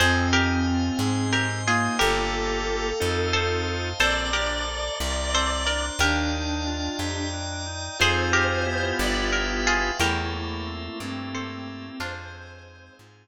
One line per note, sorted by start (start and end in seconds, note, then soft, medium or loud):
0.00 0.91 F2 loud
0.00 0.30 C4 loud
0.00 1.36 C4 loud
0.00 0.28 G#4 medium
0.00 0.28 C5 medium
0.00 0.99 C5 medium
0.00 0.99 D#5 medium
0.00 0.99 F5 loud
0.00 0.99 G#5 medium
0.33 0.64 D#4 medium
0.33 1.21 G4 medium
0.33 1.21 A#4 medium
0.67 0.97 F4 medium
0.99 1.89 G#2 medium
0.99 1.30 G#4 medium
0.99 1.99 C5 medium
0.99 1.99 D#5 medium
0.99 1.99 G#5 medium
0.99 1.99 C6 medium
1.33 1.64 C4 medium
1.33 1.62 G4 medium
1.33 1.62 A#4 medium
1.67 1.96 A#3 loud
1.67 1.97 D#4 medium
1.67 1.98 F4 medium
1.67 1.98 G#4 medium
1.99 2.93 G1 loud
1.99 2.90 A#3 loud
1.99 2.90 F4 loud
1.99 3.27 G4 medium
1.99 2.90 G4 loud
1.99 2.90 A4 loud
1.99 3.70 A4 loud
1.99 3.27 A#4 medium
1.99 2.99 A#4 medium
1.99 2.99 F5 medium
1.99 2.99 G5 medium
1.99 2.99 A5 medium
3.00 3.94 F2 medium
3.00 3.90 C4 loud
3.00 3.90 D#4 loud
3.00 3.90 F4 loud
3.00 3.90 A4 loud
3.00 3.99 C5 loud
3.00 3.99 D#5 medium
3.00 3.99 F5 loud
3.00 3.99 A5 loud
3.33 3.94 A4 medium
3.33 3.94 C5 medium
3.99 4.90 A#1 medium
3.99 4.30 C4 loud
3.99 4.30 A4 medium
3.99 4.98 C5 medium
3.99 4.30 C5 medium
3.99 4.98 D5 medium
3.99 5.79 D5 loud
3.99 4.98 A5 medium
3.99 4.98 A#5 medium
4.33 4.63 D4 medium
4.33 5.21 G4 medium
4.33 5.21 A#4 medium
4.67 4.97 A4 medium
5.00 5.90 C2 medium
5.00 5.31 A#4 medium
5.00 6.00 C5 medium
5.00 6.00 D5 medium
5.00 6.00 A#5 loud
5.00 6.00 C6 loud
5.33 5.63 C4 medium
5.33 5.63 A4 medium
5.33 5.63 C5 medium
5.66 5.96 D4 medium
5.66 5.93 A#4 medium
5.66 5.93 D5 medium
5.99 6.89 D#2 loud
5.99 6.29 D4 loud
5.99 7.21 D4 loud
5.99 6.98 G4 medium
5.99 6.98 A#4 medium
5.99 6.99 D5 loud
5.99 6.99 D#5 medium
5.99 7.00 F5 medium
5.99 6.99 G5 loud
6.32 6.62 D#4 medium
6.67 6.97 F4 medium
6.99 7.89 F2 medium
6.99 7.29 G4 medium
6.99 7.98 D5 medium
6.99 7.98 D#5 medium
6.99 7.98 G5 medium
6.99 7.98 A#5 medium
7.33 7.63 D4 medium
7.66 7.96 D#4 medium
7.99 8.93 F2 medium
7.99 8.63 C4 loud
7.99 8.63 D#4 loud
7.99 8.63 F4 loud
7.99 8.63 G#4 loud
7.99 8.30 G#4 medium
7.99 8.98 C5 medium
7.99 8.86 C5 loud
7.99 8.30 C5 loud
7.99 8.98 D#5 medium
7.99 8.98 F5 medium
7.99 8.98 G#5 medium
8.33 9.28 G4 medium
8.33 9.28 A#4 medium
8.66 9.89 B3 loud
8.66 9.89 E4 loud
8.66 9.89 F4 loud
8.66 9.89 G4 loud
8.99 9.91 G1 loud
8.99 10.00 B4 medium
8.99 9.28 D5 loud
8.99 9.99 E5 medium
8.99 10.00 F5 loud
8.99 10.00 G5 medium
9.33 9.60 A#4 medium
9.67 9.98 F4 medium
9.67 9.98 G#4 medium
9.99 10.89 E2 loud
9.99 11.89 A3 loud
9.99 10.32 E4 loud
9.99 11.29 G4 medium
9.99 10.99 A4 medium
9.99 10.99 A#4 medium
9.99 11.29 A#4 medium
9.99 10.99 C5 medium
9.99 10.99 E5 medium
10.33 11.67 A#3 medium
10.33 10.98 E4 loud
10.67 11.33 C4 medium
10.99 11.90 G2 medium
10.99 11.96 C4 loud
10.99 11.94 E4 medium
10.99 11.99 G4 loud
10.99 11.99 A4 medium
10.99 11.99 A#4 loud
10.99 11.99 E5 medium
11.33 11.97 C4 medium
11.33 11.88 A4 medium
11.33 11.88 C5 medium
11.67 11.99 A#3 medium
12.00 12.90 F2 loud
12.00 13.27 G#3 loud
12.00 12.97 D4 medium
12.00 12.97 F4 medium
12.00 12.99 G#4 medium
12.00 12.99 C5 medium
12.00 12.98 C5 loud
12.00 12.99 D#5 medium
12.00 12.99 F5 medium
12.33 13.27 C4 medium
12.67 13.27 D#4 medium
12.99 13.27 G#2 medium
12.99 13.27 F4 medium
12.99 13.27 G#4 medium
12.99 13.27 C5 medium
12.99 13.27 F5 medium
12.99 13.27 G#5 loud